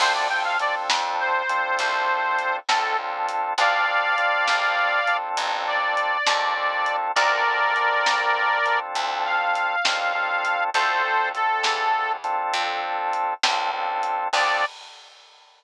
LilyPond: <<
  \new Staff \with { instrumentName = "Harmonica" } { \time 12/8 \key d \minor \tempo 4. = 67 c''16 d''16 g''16 f''16 d''16 r8. c''2~ c''8 a'8 r4 | <d'' f''>2. r8 d''2~ d''8 | <bes' d''>2. r8 f''2~ f''8 | <a' c''>4 a'4. r2. r8 |
d''4. r1 r8 | }
  \new Staff \with { instrumentName = "Drawbar Organ" } { \time 12/8 \key d \minor <c' d' f' a'>8 <c' d' f' a'>8 <c' d' f' a'>4. <c' d' f' a'>2 <c' d' f' a'>8 <c' d' f' a'>4 | <c' d' f' a'>8 <c' d' f' a'>8 <c' d' f' a'>4. <c' d' f' a'>2 <c' d' f' a'>8 <c' d' f' a'>4 | <c' d' f' a'>8 <c' d' f' a'>8 <c' d' f' a'>4. <c' d' f' a'>2 <c' d' f' a'>8 <c' d' f' a'>4 | <c' d' f' a'>8 <c' d' f' a'>8 <c' d' f' a'>4. <c' d' f' a'>2 <c' d' f' a'>8 <c' d' f' a'>4 |
<c' d' f' a'>4. r1 r8 | }
  \new Staff \with { instrumentName = "Electric Bass (finger)" } { \clef bass \time 12/8 \key d \minor d,4. f,4. c,4. cis,4. | d,4. bes,,4. a,,4. ees,4. | d,4. c,4. d,4. ees,4. | d,4. e,4. f,4. cis,4. |
d,4. r1 r8 | }
  \new DrumStaff \with { instrumentName = "Drums" } \drummode { \time 12/8 <cymc bd>4 hh8 sn4 hh8 <hh bd>4 hh8 sn4 hh8 | <hh bd>4 hh8 sn4 hh8 <hh bd>4 hh8 sn4 hh8 | <hh bd>4 hh8 sn4 hh8 <hh bd>4 hh8 sn4 hh8 | <hh bd>4 hh8 sn4 hh8 <hh bd>4 hh8 sn4 hh8 |
<cymc bd>4. r4. r4. r4. | }
>>